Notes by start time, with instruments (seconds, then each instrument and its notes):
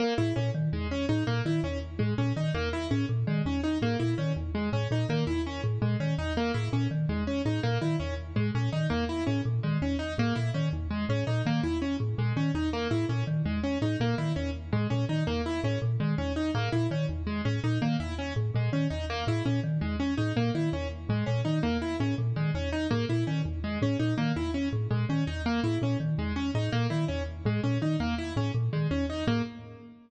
0.00 acoustic grand piano A#3
0.18 marimba A2, acoustic grand piano E4
0.36 marimba A#2, acoustic grand piano C#4
0.55 marimba D#3
0.73 marimba E2, acoustic grand piano G#3
0.91 acoustic grand piano C#4
1.09 marimba A2, acoustic grand piano D#4
1.27 marimba A#2, acoustic grand piano A#3
1.45 marimba D#3, acoustic grand piano E4
1.64 marimba E2, acoustic grand piano C#4
1.99 marimba A2, acoustic grand piano G#3
2.18 marimba A#2, acoustic grand piano C#4
2.36 marimba D#3, acoustic grand piano D#4
2.54 marimba E2, acoustic grand piano A#3
2.73 acoustic grand piano E4
2.91 marimba A2, acoustic grand piano C#4
3.09 marimba A#2
3.27 marimba D#3, acoustic grand piano G#3
3.45 marimba E2, acoustic grand piano C#4
3.63 acoustic grand piano D#4
3.82 marimba A2, acoustic grand piano A#3
3.99 marimba A#2, acoustic grand piano E4
4.18 marimba D#3, acoustic grand piano C#4
4.36 marimba E2
4.55 acoustic grand piano G#3
4.73 marimba A2, acoustic grand piano C#4
4.91 marimba A#2, acoustic grand piano D#4
5.09 marimba D#3, acoustic grand piano A#3
5.27 marimba E2, acoustic grand piano E4
5.46 acoustic grand piano C#4
5.64 marimba A2
5.82 marimba A#2, acoustic grand piano G#3
6.00 marimba D#3, acoustic grand piano C#4
6.18 marimba E2, acoustic grand piano D#4
6.37 acoustic grand piano A#3
6.54 marimba A2, acoustic grand piano E4
6.73 marimba A#2, acoustic grand piano C#4
6.91 marimba D#3
7.09 marimba E2, acoustic grand piano G#3
7.27 acoustic grand piano C#4
7.45 marimba A2, acoustic grand piano D#4
7.63 marimba A#2, acoustic grand piano A#3
7.82 marimba D#3, acoustic grand piano E4
8.00 marimba E2, acoustic grand piano C#4
8.36 marimba A2, acoustic grand piano G#3
8.55 marimba A#2, acoustic grand piano C#4
8.72 marimba D#3, acoustic grand piano D#4
8.90 marimba E2, acoustic grand piano A#3
9.09 acoustic grand piano E4
9.27 marimba A2, acoustic grand piano C#4
9.45 marimba A#2
9.63 marimba D#3, acoustic grand piano G#3
9.82 marimba E2, acoustic grand piano C#4
9.99 acoustic grand piano D#4
10.18 marimba A2, acoustic grand piano A#3
10.35 marimba A#2, acoustic grand piano E4
10.54 marimba D#3, acoustic grand piano C#4
10.73 marimba E2
10.91 acoustic grand piano G#3
11.09 marimba A2, acoustic grand piano C#4
11.27 marimba A#2, acoustic grand piano D#4
11.46 marimba D#3, acoustic grand piano A#3
11.63 marimba E2, acoustic grand piano E4
11.82 acoustic grand piano C#4
12.00 marimba A2
12.18 marimba A#2, acoustic grand piano G#3
12.36 marimba D#3, acoustic grand piano C#4
12.55 marimba E2, acoustic grand piano D#4
12.73 acoustic grand piano A#3
12.91 marimba A2, acoustic grand piano E4
13.09 marimba A#2, acoustic grand piano C#4
13.27 marimba D#3
13.45 marimba E2, acoustic grand piano G#3
13.64 acoustic grand piano C#4
13.82 marimba A2, acoustic grand piano D#4
14.00 marimba A#2, acoustic grand piano A#3
14.18 marimba D#3, acoustic grand piano E4
14.36 marimba E2, acoustic grand piano C#4
14.73 marimba A2, acoustic grand piano G#3
14.90 marimba A#2, acoustic grand piano C#4
15.09 marimba D#3, acoustic grand piano D#4
15.27 marimba E2, acoustic grand piano A#3
15.46 acoustic grand piano E4
15.64 marimba A2, acoustic grand piano C#4
15.82 marimba A#2
16.00 marimba D#3, acoustic grand piano G#3
16.18 marimba E2, acoustic grand piano C#4
16.36 acoustic grand piano D#4
16.55 marimba A2, acoustic grand piano A#3
16.72 marimba A#2, acoustic grand piano E4
16.91 marimba D#3, acoustic grand piano C#4
17.09 marimba E2
17.27 acoustic grand piano G#3
17.45 marimba A2, acoustic grand piano C#4
17.64 marimba A#2, acoustic grand piano D#4
17.82 marimba D#3, acoustic grand piano A#3
18.00 marimba E2, acoustic grand piano E4
18.19 acoustic grand piano C#4
18.36 marimba A2
18.55 marimba A#2, acoustic grand piano G#3
18.73 marimba D#3, acoustic grand piano C#4
18.90 marimba E2, acoustic grand piano D#4
19.10 acoustic grand piano A#3
19.27 marimba A2, acoustic grand piano E4
19.45 marimba A#2, acoustic grand piano C#4
19.64 marimba D#3
19.81 marimba E2, acoustic grand piano G#3
20.00 acoustic grand piano C#4
20.17 marimba A2, acoustic grand piano D#4
20.36 marimba A#2, acoustic grand piano A#3
20.55 marimba D#3, acoustic grand piano E4
20.73 marimba E2, acoustic grand piano C#4
21.09 marimba A2, acoustic grand piano G#3
21.26 marimba A#2, acoustic grand piano C#4
21.45 marimba D#3, acoustic grand piano D#4
21.63 marimba E2, acoustic grand piano A#3
21.82 acoustic grand piano E4
22.00 marimba A2, acoustic grand piano C#4
22.18 marimba A#2
22.36 marimba D#3, acoustic grand piano G#3
22.55 marimba E2, acoustic grand piano C#4
22.72 acoustic grand piano D#4
22.91 marimba A2, acoustic grand piano A#3
23.09 marimba A#2, acoustic grand piano E4
23.27 marimba D#3, acoustic grand piano C#4
23.45 marimba E2
23.64 acoustic grand piano G#3
23.82 marimba A2, acoustic grand piano C#4
23.99 marimba A#2, acoustic grand piano D#4
24.18 marimba D#3, acoustic grand piano A#3
24.36 marimba E2, acoustic grand piano E4
24.54 acoustic grand piano C#4
24.73 marimba A2
24.91 marimba A#2, acoustic grand piano G#3
25.09 marimba D#3, acoustic grand piano C#4
25.27 marimba E2, acoustic grand piano D#4
25.46 acoustic grand piano A#3
25.64 marimba A2, acoustic grand piano E4
25.82 marimba A#2, acoustic grand piano C#4
26.00 marimba D#3
26.18 marimba E2, acoustic grand piano G#3
26.36 acoustic grand piano C#4
26.55 marimba A2, acoustic grand piano D#4
26.72 marimba A#2, acoustic grand piano A#3
26.90 marimba D#3, acoustic grand piano E4
27.08 marimba E2, acoustic grand piano C#4
27.45 marimba A2, acoustic grand piano G#3
27.63 marimba A#2, acoustic grand piano C#4
27.82 marimba D#3, acoustic grand piano D#4
28.00 marimba E2, acoustic grand piano A#3
28.18 acoustic grand piano E4
28.36 marimba A2, acoustic grand piano C#4
28.54 marimba A#2
28.73 marimba D#3, acoustic grand piano G#3
28.91 marimba E2, acoustic grand piano C#4
29.10 acoustic grand piano D#4
29.27 marimba A2, acoustic grand piano A#3